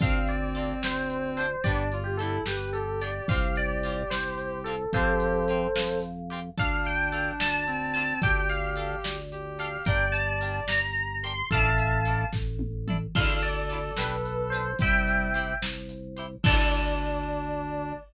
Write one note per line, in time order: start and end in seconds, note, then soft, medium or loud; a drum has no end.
0.00 0.74 D2 loud
0.00 1.38 C4 medium
0.00 0.19 C4 loud
0.00 0.19 D4 loud
0.00 0.19 F4 loud
0.00 0.19 A4 loud
0.00 0.28 F5 medium
0.00 kick loud
0.00 closed hi-hat medium
0.28 0.80 D5 medium
0.28 closed hi-hat medium
0.55 0.74 C4 medium
0.55 0.74 D4 medium
0.55 0.74 F4 medium
0.55 0.74 A4 loud
0.55 closed hi-hat medium
0.82 1.56 D2 medium
0.82 1.30 C5 medium
0.82 snare medium
1.10 closed hi-hat medium
1.37 1.47 C4 loud
1.37 1.47 D4 loud
1.37 1.47 F4 medium
1.37 1.47 A4 loud
1.37 1.63 C5 medium
1.37 closed hi-hat medium
1.64 2.39 G1 loud
1.64 1.84 B3 loud
1.64 1.89 D4 loud
1.64 1.84 D4 loud
1.64 1.84 G4 loud
1.64 1.98 D5 medium
1.64 kick medium
1.64 closed hi-hat medium
1.92 2.18 F4 medium
1.92 closed hi-hat medium
2.04 2.17 G4 medium
2.17 2.38 D4 loud
2.17 2.42 E4 medium
2.17 2.38 G4 loud
2.17 2.43 A4 medium
2.17 closed hi-hat medium
2.22 2.38 B3 loud
2.46 3.21 G1 medium
2.46 2.73 G4 medium
2.46 2.70 B4 medium
2.46 snare medium
2.73 3.26 G4 medium
2.73 2.99 A4 medium
2.73 closed hi-hat medium
3.01 3.11 B3 medium
3.01 3.11 D4 loud
3.01 3.11 G4 medium
3.01 3.28 D5 medium
3.01 closed hi-hat medium
3.28 4.03 C2 loud
3.28 3.48 C4 loud
3.28 3.48 F4 loud
3.28 3.48 G4 loud
3.28 4.70 G4 medium
3.28 3.55 F5 medium
3.28 kick medium
3.28 closed hi-hat medium
3.56 4.09 D5 medium
3.56 closed hi-hat medium
3.83 4.03 C4 medium
3.83 4.03 F4 loud
3.83 4.03 G4 medium
3.83 closed hi-hat medium
4.10 4.85 C2 medium
4.10 4.58 C5 medium
4.10 snare medium
4.38 closed hi-hat medium
4.64 4.75 F4 loud
4.64 4.75 G4 loud
4.64 4.89 A4 medium
4.64 closed hi-hat medium
4.68 4.75 C4 loud
4.93 5.67 F2 loud
4.93 5.12 C4 loud
4.93 5.12 F4 loud
4.93 5.12 G4 loud
4.93 5.43 G4 medium
4.93 5.98 A4 medium
4.93 5.98 C5 loud
4.93 kick medium
4.93 closed hi-hat medium
5.20 closed hi-hat medium
5.48 5.67 C4 loud
5.48 5.67 F4 loud
5.48 5.67 G4 medium
5.48 closed hi-hat medium
5.76 6.50 F2 medium
5.76 snare medium
6.02 closed hi-hat medium
6.30 6.40 C4 loud
6.30 6.40 F4 loud
6.30 6.40 G4 medium
6.30 closed hi-hat medium
6.58 7.32 D2 loud
6.58 7.65 D4 medium
6.58 6.77 D4 loud
6.58 6.77 F4 loud
6.58 6.77 A4 loud
6.58 6.86 F5 loud
6.58 kick medium
6.58 closed hi-hat medium
6.85 7.32 G5 medium
6.85 closed hi-hat medium
7.12 7.32 D4 medium
7.12 7.32 F4 loud
7.12 7.32 A4 loud
7.12 closed hi-hat medium
7.40 8.14 D2 medium
7.40 7.93 A5 medium
7.40 snare loud
7.66 8.20 C4 medium
7.66 closed hi-hat medium
7.93 8.04 D4 loud
7.93 8.04 F4 loud
7.93 8.04 A4 medium
7.93 8.18 A5 medium
7.93 closed hi-hat medium
8.22 8.96 D2 loud
8.22 8.41 D4 loud
8.22 9.17 G4 loud
8.22 8.41 G4 loud
8.22 8.41 A4 loud
8.22 8.47 G5 medium
8.22 kick medium
8.22 closed hi-hat medium
8.49 8.98 F5 medium
8.49 closed hi-hat medium
8.76 8.96 D4 medium
8.76 8.96 G4 medium
8.76 8.96 A4 loud
8.76 closed hi-hat medium
9.04 9.78 D2 medium
9.04 snare medium
9.32 9.83 G4 medium
9.32 closed hi-hat medium
9.59 9.68 D4 medium
9.59 9.68 G4 loud
9.59 9.68 A4 loud
9.59 9.85 F5 medium
9.59 closed hi-hat medium
9.85 10.60 G1 loud
9.85 10.05 D4 loud
9.85 10.05 G4 loud
9.85 10.05 A#4 loud
9.85 10.78 D5 loud
9.85 10.12 G5 medium
9.85 kick medium
9.85 closed hi-hat medium
10.12 10.58 A5 medium
10.12 closed hi-hat medium
10.41 10.60 D4 loud
10.41 10.60 G4 medium
10.41 10.60 A#4 loud
10.41 closed hi-hat medium
10.68 11.42 G1 medium
10.68 11.17 A#5 medium
10.68 snare medium
10.95 closed hi-hat soft
11.23 11.33 D4 loud
11.23 11.33 G4 loud
11.23 11.33 A#4 medium
11.23 11.46 C6 medium
11.23 closed hi-hat medium
11.51 12.25 A1 loud
11.51 11.70 D4 loud
11.51 11.70 E4 loud
11.51 11.70 A4 loud
11.51 11.98 E5 medium
11.51 12.25 F5 medium
11.51 12.25 A5 medium
11.51 kick medium
11.51 closed hi-hat medium
11.78 closed hi-hat medium
12.05 12.25 D4 medium
12.05 12.25 E4 loud
12.05 12.25 A4 medium
12.05 closed hi-hat medium
12.33 13.07 A1 medium
12.33 kick medium
12.33 snare medium
12.59 high tom medium
12.88 12.97 D4 loud
12.88 12.97 E4 medium
12.88 12.97 A4 loud
12.88 mid tom medium
13.15 13.91 D2 loud
13.15 13.34 D4 loud
13.15 13.34 E4 loud
13.15 13.34 F4 loud
13.15 14.70 A4 medium
13.15 13.34 A4 loud
13.15 13.40 F5 loud
13.15 kick medium
13.15 crash medium
13.42 13.92 D5 medium
13.42 closed hi-hat medium
13.70 13.79 D4 medium
13.70 13.79 E4 loud
13.70 13.79 F4 loud
13.70 13.79 A4 loud
13.70 closed hi-hat medium
13.97 14.73 B1 loud
13.97 14.16 D4 loud
13.97 14.16 G4 loud
13.97 14.16 B4 loud
13.97 14.48 B4 medium
13.97 snare medium
14.25 closed hi-hat medium
14.50 14.62 G4 medium
14.50 14.62 B4 medium
14.50 14.76 C5 medium
14.50 closed hi-hat medium
14.54 14.62 D4 loud
14.79 15.54 C2 medium
14.79 15.28 G3 medium
14.79 14.99 E4 loud
14.79 14.99 G4 loud
14.79 14.99 C5 loud
14.79 15.54 E5 medium
14.79 15.54 G5 loud
14.79 kick medium
14.79 closed hi-hat medium
15.07 closed hi-hat medium
15.34 15.53 E4 loud
15.34 15.53 G4 loud
15.34 15.53 C5 loud
15.34 closed hi-hat medium
15.62 16.36 C2 medium
15.62 snare medium
15.89 closed hi-hat medium
16.16 16.26 E4 medium
16.16 16.26 G4 loud
16.16 16.26 C5 loud
16.16 closed hi-hat medium
16.43 17.93 D2 loud
16.43 17.92 D4 loud
16.43 17.93 E4 loud
16.43 17.93 F4 loud
16.43 17.93 A4 loud
16.43 17.95 D5 loud
16.43 kick loud
16.43 crash loud
16.47 17.93 D4 loud